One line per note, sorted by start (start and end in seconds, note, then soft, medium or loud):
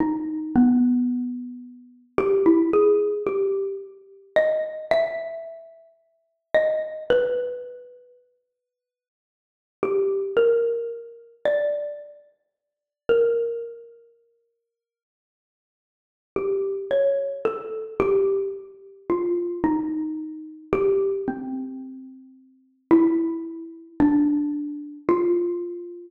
0.00 0.49 D#4 medium
0.56 2.03 B3 medium
2.18 2.43 G4 loud
2.46 2.70 E4 medium
2.73 3.22 G#4 medium
3.27 3.76 G4 medium
4.36 4.85 D#5 medium
4.91 5.90 E5 loud
6.55 7.04 D#5 medium
7.10 8.08 B4 loud
9.83 10.32 G4 medium
10.37 11.35 A#4 medium
11.45 12.93 D5 medium
13.09 15.05 A#4 medium
16.36 16.85 G4 medium
16.91 17.40 C#5 medium
17.45 17.94 A4 medium
18.00 18.49 G4 loud
19.10 19.59 F4 medium
19.64 20.62 D#4 medium
20.73 21.22 G4 loud
21.28 22.75 C4 medium
22.91 23.89 E4 loud
24.00 24.98 D4 medium
25.09 26.07 F4 loud